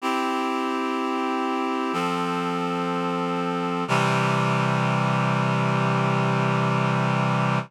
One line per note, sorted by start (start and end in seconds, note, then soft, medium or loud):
0.02 1.92 C4 medium
0.02 1.93 E4 medium
0.02 1.93 G4 medium
1.93 3.84 F3 medium
1.93 3.84 C4 medium
1.93 3.84 A4 medium
3.88 7.59 C3 loud
3.88 7.59 E3 loud
3.88 7.59 G3 loud